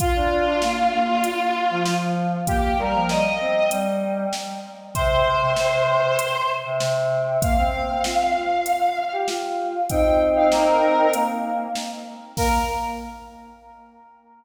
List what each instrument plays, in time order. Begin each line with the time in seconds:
0.00 choir aahs F4, kick, closed hi-hat
0.15 choir aahs D4
0.31 choir aahs D4
0.47 choir aahs D4
0.62 choir aahs A#3, snare
0.92 choir aahs A#3
1.24 closed hi-hat
1.70 choir aahs F3
1.86 choir aahs F3, snare
2.47 choir aahs A#3 G4, kick, closed hi-hat
2.78 choir aahs G3 A#4
2.94 choir aahs F3
3.09 choir aahs G3 D#5, snare
3.40 choir aahs C4
3.71 choir aahs G3, closed hi-hat
4.33 snare
4.95 choir aahs C3 C5, kick, closed hi-hat
5.10 choir aahs C3
5.26 choir aahs C3
5.41 choir aahs C3
5.56 choir aahs C3, snare
5.88 choir aahs C3
6.19 closed hi-hat
6.64 choir aahs C3
6.80 choir aahs C3, snare
7.42 choir aahs A#3 F5, kick, closed hi-hat
7.57 choir aahs C4
7.73 choir aahs C4
7.89 choir aahs C4
8.04 choir aahs F4, snare
8.35 choir aahs F4
8.66 closed hi-hat
9.12 choir aahs G4
9.28 choir aahs F4, snare
9.90 choir aahs C4 D#4 G5, kick, closed hi-hat
10.36 choir aahs F5
10.52 choir aahs A#4, snare
11.13 choir aahs A#3, closed hi-hat
11.75 snare
12.37 choir aahs A#3 A#4, kick, crash